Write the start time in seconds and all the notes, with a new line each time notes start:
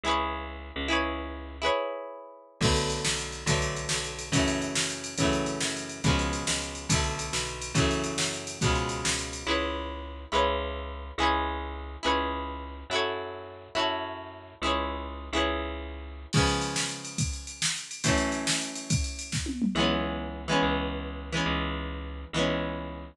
0.04 C#2 E4 G#4
0.08 B4 C#5
0.76 C#2
0.88 E4 G#4 B4
0.93 C#5
1.62 E4 G#4 B4
1.66 C#5
2.61 B1 D3 F#3 A3, kick, crash
2.65 B3
2.76 ride
2.90 ride
3.05 B1, snare
3.18 ride
3.32 ride
3.46 B1 D3 F#3 A3, kick, ride
3.51 B3
3.62 ride
3.76 ride
3.89 B1, snare
4.04 ride
4.19 ride
4.32 F#2 C#3 E3 F#3, kick, ride
4.37 A3
4.48 ride
4.62 ride
4.75 F#2, snare
4.90 ride
5.04 ride
5.18 F#2 C#3 E3 F#3, kick, ride
5.23 A3
5.33 ride
5.46 ride
5.60 F#2, snare
5.76 ride
5.89 ride
6.04 C#2 B2 C#3 F3, kick, ride
6.09 G#3
6.19 ride
6.33 ride
6.47 C#2, snare
6.62 ride
6.75 ride
6.89 B1 B2 D3 F#3, kick, ride
6.94 A3
7.04 ride
7.19 ride
7.33 B1, snare
7.47 ride
7.62 ride
7.74 F#2 C#3 E3 F#3, kick, ride
7.79 A3
7.91 ride
8.04 ride
8.18 F#2, snare
8.34 ride
8.47 ride
8.61 C#2 B2 C#3, kick, ride
8.65 F3 G#3
8.75 ride
8.89 ride
9.04 C#2, snare
9.19 ride
9.33 ride
9.47 C#2 E4 G#4 B4
9.51 C#5
10.32 C#2 E4 G#4 B4
10.36 C#5
11.18 C#2 E4 G#4 B4
11.23 C#5
12.03 C#2 E4 G#4 B4
12.07 C#5
12.90 F#2 E4 F#4
12.94 A4 C#5
13.75 F#2 E4 F#4 A4
13.79 C#5
14.62 C#2 E4 G#4
14.66 B4 C#5
15.33 C#2 E4 G#4 B4
15.38 C#5
16.33 C#3 F3, kick, crash
16.37 G#3 B3
16.47 ride
16.61 ride
16.76 snare
16.89 ride
17.05 ride
17.18 kick, ride
17.33 ride
17.47 ride
17.62 snare
17.76 ride
17.91 ride
18.04 F#2 E3 A3, kick, ride
18.08 C#4
18.17 ride
18.32 ride
18.47 snare
18.61 ride
18.75 ride
18.90 kick, ride
19.04 ride
19.19 ride
19.32 kick, snare
19.46 high tom
19.62 mid tom
19.75 C#2 E3 G#3 B3
19.80 C#4
20.48 E3 G#3 B3
20.52 C#4
20.63 C#2
21.32 E3 G#3 B3
21.37 C#4
21.46 C#2
22.33 C#2 E3 G#3 B3
22.39 C#4